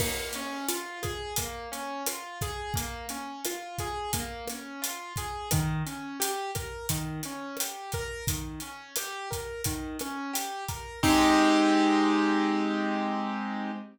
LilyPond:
<<
  \new Staff \with { instrumentName = "Acoustic Grand Piano" } { \time 4/4 \key aes \major \tempo 4 = 87 bes8 des'8 f'8 aes'8 bes8 des'8 f'8 aes'8 | bes8 des'8 f'8 aes'8 bes8 des'8 f'8 aes'8 | ees8 des'8 g'8 bes'8 ees8 des'8 g'8 bes'8 | ees8 des'8 g'8 bes'8 ees8 des'8 g'8 bes'8 |
<aes c' ees' g'>1 | }
  \new DrumStaff \with { instrumentName = "Drums" } \drummode { \time 4/4 <cymc bd ss>8 hh8 hh8 <hh bd ss>8 <hh bd>8 hh8 <hh ss>8 <hh bd>8 | <hh bd>8 hh8 <hh ss>8 <hh bd>8 <hh bd>8 <hh ss>8 hh8 <hh bd>8 | <hh bd ss>8 hh8 hh8 <hh bd ss>8 <hh bd>8 hh8 <hh ss>8 <hh bd>8 | <hh bd>8 hh8 <hh ss>8 <hh bd>8 <hh bd>8 <hh ss>8 hh8 <hh bd>8 |
<cymc bd>4 r4 r4 r4 | }
>>